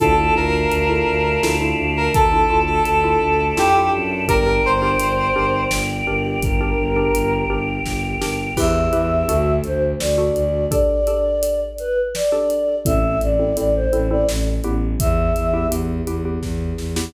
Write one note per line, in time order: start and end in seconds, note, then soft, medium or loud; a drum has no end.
0.00 0.30 D2 loud
0.00 0.14 D4 loud
0.00 0.14 E4 loud
0.00 0.14 F4 loud
0.00 0.14 A4 loud
0.00 0.34 A4 loud
0.00 2.11 D5 medium
0.00 2.11 E5 medium
0.00 2.11 F5 medium
0.00 2.11 A5 medium
0.00 kick medium
0.00 closed hi-hat medium
0.18 0.32 D4 medium
0.18 0.32 E4 medium
0.18 0.32 F4 medium
0.18 0.32 A4 medium
0.36 0.66 D2 loud
0.36 0.78 D4 medium
0.36 0.78 E4 medium
0.36 0.78 F4 loud
0.36 0.78 A4 medium
0.36 1.41 A#4 medium
0.71 1.02 D2 medium
0.71 closed hi-hat medium
0.89 1.32 D4 medium
0.89 1.32 E4 medium
0.89 1.32 F4 medium
0.89 1.32 A4 medium
1.07 1.38 D2 medium
1.43 1.73 D2 medium
1.43 1.57 D4 medium
1.43 1.57 E4 medium
1.43 1.57 F4 medium
1.43 1.57 A4 loud
1.43 snare loud
1.61 2.18 D4 medium
1.61 2.18 E4 loud
1.61 2.18 F4 medium
1.61 2.18 A4 medium
1.78 2.09 D2 medium
1.97 2.14 A#4 medium
2.14 2.44 D2 medium
2.14 2.59 A4 loud
2.14 4.26 A4 medium
2.14 4.26 D5 medium
2.14 4.26 E5 medium
2.14 4.26 A5 medium
2.14 kick loud
2.14 closed hi-hat medium
2.32 2.46 D4 medium
2.32 2.46 E4 medium
2.32 2.46 F4 medium
2.32 2.46 A4 medium
2.50 2.80 D2 medium
2.50 2.93 D4 medium
2.50 2.93 E4 medium
2.50 2.93 F4 loud
2.50 2.93 A4 medium
2.66 2.83 A4 medium
2.85 3.16 D2 medium
2.85 3.48 A4 medium
2.85 closed hi-hat medium
3.04 3.46 D4 medium
3.04 3.46 E4 medium
3.04 3.46 F4 medium
3.04 3.46 A4 medium
3.21 3.52 D2 medium
3.57 3.90 F2 medium
3.57 3.71 D4 medium
3.57 3.71 E4 medium
3.57 3.71 F4 medium
3.57 3.90 G4 loud
3.57 3.71 A4 medium
3.57 snare medium
3.75 4.18 D4 medium
3.75 4.18 E4 loud
3.75 4.18 F4 medium
3.75 4.18 A4 medium
3.93 4.25 F#2 medium
4.28 4.60 G1 loud
4.28 4.43 D4 loud
4.28 4.43 G4 loud
4.28 6.40 A#4 medium
4.28 4.43 A#4 loud
4.28 4.62 A#4 loud
4.28 6.40 D5 medium
4.28 6.40 G5 medium
4.28 kick medium
4.28 closed hi-hat medium
4.46 4.75 D4 medium
4.46 4.75 G4 medium
4.46 4.75 A#4 loud
4.65 4.95 G1 loud
4.65 5.61 C5 medium
4.82 5.25 D4 medium
4.82 5.25 G4 medium
4.82 5.25 A#4 medium
5.00 5.30 G1 medium
5.00 closed hi-hat loud
5.36 5.66 G1 medium
5.36 5.93 D4 loud
5.36 5.93 G4 loud
5.36 5.93 A#4 medium
5.71 6.02 G1 medium
5.71 snare loud
6.07 6.37 G1 loud
6.07 6.50 D4 medium
6.07 6.50 G4 medium
6.07 6.50 A#4 medium
6.25 6.42 G4 medium
6.43 6.73 G1 medium
6.43 8.56 G4 medium
6.43 7.33 A#4 medium
6.43 8.56 A#4 medium
6.43 8.56 G5 medium
6.43 kick loud
6.43 closed hi-hat medium
6.61 6.89 D4 loud
6.61 6.89 G4 medium
6.61 6.89 A#4 medium
6.78 7.09 G1 medium
6.96 7.39 D4 loud
6.96 7.39 G4 medium
6.96 7.39 A#4 medium
7.14 7.44 G1 loud
7.14 closed hi-hat medium
7.50 7.80 G1 medium
7.50 8.07 D4 medium
7.50 8.07 G4 medium
7.50 8.07 A#4 medium
7.85 8.16 G1 medium
7.85 kick medium
7.85 snare medium
8.21 8.52 G1 medium
8.21 8.50 D4 medium
8.21 8.50 G4 loud
8.21 8.50 A#4 medium
8.21 snare medium
8.57 8.88 E2 loud
8.57 8.86 E4 loud
8.57 8.86 G4 loud
8.57 8.86 B4 loud
8.57 9.53 E5 medium
8.57 kick medium
8.57 crash loud
8.93 9.23 E2 loud
8.93 9.21 E4 medium
8.93 9.21 G4 medium
8.93 9.21 B4 medium
8.93 closed hi-hat medium
9.29 9.59 D2 loud
9.29 9.86 D4 medium
9.29 9.86 F#4 medium
9.29 9.86 A4 medium
9.29 closed hi-hat loud
9.64 9.94 D2 medium
9.64 9.82 C5 medium
9.64 closed hi-hat medium
10.00 10.31 D2 medium
10.00 10.65 D5 medium
10.00 snare loud
10.18 10.61 D4 medium
10.18 10.61 F#4 medium
10.18 10.61 A4 medium
10.36 10.66 D2 medium
10.36 closed hi-hat medium
10.71 11.00 D4 medium
10.71 11.00 G4 medium
10.71 11.00 A4 loud
10.71 11.60 D5 medium
10.71 kick medium
10.71 closed hi-hat loud
11.07 11.64 D4 medium
11.07 11.64 G4 medium
11.07 11.64 A4 medium
11.07 closed hi-hat medium
11.43 closed hi-hat loud
11.78 11.96 B4 medium
11.78 closed hi-hat medium
12.15 12.76 D5 medium
12.15 snare medium
12.32 12.75 D4 medium
12.32 12.75 G4 medium
12.32 12.75 A4 medium
12.50 closed hi-hat medium
12.85 13.16 A1 loud
12.85 13.29 C4 medium
12.85 13.29 E4 medium
12.85 13.29 A4 medium
12.85 13.18 E5 medium
12.85 kick loud
12.85 closed hi-hat loud
13.21 13.51 A1 medium
13.21 13.56 D5 medium
13.21 closed hi-hat medium
13.39 13.54 C4 medium
13.39 13.54 E4 medium
13.39 13.54 A4 medium
13.57 13.87 A1 medium
13.57 13.86 C4 medium
13.57 13.86 E4 medium
13.57 13.86 A4 medium
13.57 13.74 D5 medium
13.57 closed hi-hat medium
13.75 14.06 C5 medium
13.93 14.23 A1 medium
13.93 14.07 C4 medium
13.93 14.07 E4 medium
13.93 14.07 A4 medium
13.93 closed hi-hat medium
14.10 14.62 C4 medium
14.10 14.62 E4 medium
14.10 14.62 A4 medium
14.10 14.27 D5 medium
14.28 14.59 A1 medium
14.28 snare loud
14.64 14.95 A1 medium
14.64 15.43 B3 medium
14.64 15.43 E4 medium
14.64 15.43 G4 medium
14.64 closed hi-hat medium
15.00 15.31 E2 loud
15.00 15.67 E5 medium
15.00 kick loud
15.00 closed hi-hat loud
15.35 15.66 E2 medium
15.35 closed hi-hat medium
15.54 15.68 B3 medium
15.54 15.68 E4 medium
15.54 15.68 G4 medium
15.71 16.01 E2 medium
15.71 16.00 B3 medium
15.71 16.00 E4 medium
15.71 16.00 G4 medium
15.71 closed hi-hat loud
16.07 16.38 E2 medium
16.07 16.22 B3 medium
16.07 16.22 E4 medium
16.07 16.22 G4 medium
16.07 closed hi-hat medium
16.25 16.82 B3 medium
16.25 16.82 E4 medium
16.25 16.82 G4 medium
16.43 16.73 E2 medium
16.43 kick medium
16.43 snare medium
16.78 17.09 E2 medium
16.78 snare medium
16.96 17.11 B3 medium
16.96 17.11 E4 medium
16.96 17.11 G4 medium
16.96 snare loud